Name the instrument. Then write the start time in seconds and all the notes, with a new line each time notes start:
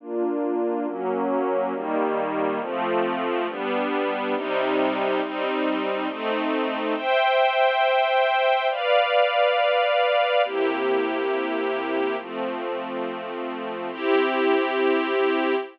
string ensemble 1
0.00 A#3 D4 F4
0.87 F#3 A#3 C#4
1.73 D#3 G3 A#3
2.61 F3 A3 C4
3.48 G3 B3 D4
4.35 C3 G3 D#4
5.22 G3 C4 D#4
6.08 A3 C4 D#4
6.95 C5 E5 G5
8.70 B4 D5 F5
10.44 C3 A#3 E4 G4
12.18 F3 A3 C4
13.91 C4 E4 G4